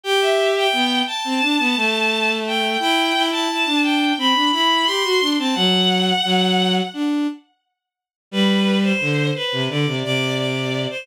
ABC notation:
X:1
M:4/4
L:1/16
Q:1/4=87
K:G
V:1 name="Violin"
g e2 g3 a8 g2 | g3 a3 g2 b2 b2 c'3 a | f8 z8 | B3 c3 B2 d2 d2 d3 c |]
V:2 name="Violin"
G4 B,2 z C D B, A,6 | E2 E E E D3 C D E2 G F D C | F,4 F,4 D2 z6 | G,4 D,2 z C, D, C, C,6 |]